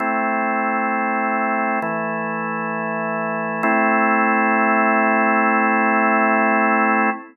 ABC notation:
X:1
M:4/4
L:1/8
Q:1/4=66
K:Am
V:1 name="Drawbar Organ"
[A,CE]4 [E,A,E]4 | [A,CE]8 |]